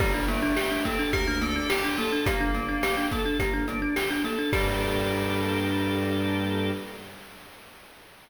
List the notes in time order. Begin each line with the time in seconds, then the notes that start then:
0.00 G1 G3 A#3 G4, kick, crash
0.14 D4
0.28 A3 A#3 D4, closed hi-hat
0.43 D4
0.56 G4, snare
0.71 D4
0.85 A#3 C4 A4, kick, closed hi-hat
0.99 D4
1.13 D2 A#3 G4 A#4, kick, closed hi-hat
1.27 D4
1.41 A#3 D4 A4, closed hi-hat
1.56 D4
1.70 G4, snare
1.84 D4
1.89 F4
1.98 A#3 A4, snare, closed hi-hat
2.08 F4
2.12 D4
2.25 G1 A#3 G4, kick, closed hi-hat
2.40 D4
2.54 A#3 D4, closed hi-hat
2.69 D4
2.83 G4, snare
2.97 D4
3.11 A#3 A4, kick, closed hi-hat
3.25 D4
3.40 G1 A#3 G4, kick, closed hi-hat
3.54 D4
3.68 A#3 D4, closed hi-hat
3.82 D4
3.96 G4, snare
4.11 D4
4.24 A#3 A4, snare, closed hi-hat
4.39 D4
4.53 G2 G3 A#3 D4 G4 A4, kick, crash